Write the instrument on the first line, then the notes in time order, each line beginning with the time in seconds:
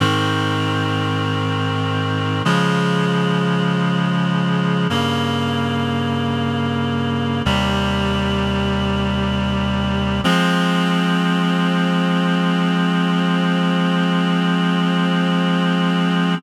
clarinet
0.00 G#2 D#3 C4
2.45 C#3 F3 G#3
4.90 G2 C#3 A#3
7.45 D#2 C3 G3
10.24 F3 G#3 C4